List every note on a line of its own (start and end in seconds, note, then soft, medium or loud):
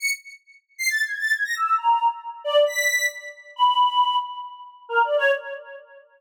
0.00 0.10 C#7 medium
0.78 0.88 C7 loud
0.88 1.02 A6 loud
1.04 1.17 G#6 medium
1.19 1.32 A6 medium
1.34 1.44 G#6 medium
1.44 1.54 A#6 medium
1.55 1.75 E6 medium
1.78 2.08 A#5 medium
2.44 2.64 D5 loud
2.66 3.06 B6 medium
3.56 4.16 B5 loud
4.89 5.02 A#4 medium
5.04 5.17 D5 medium
5.18 5.31 C#5 loud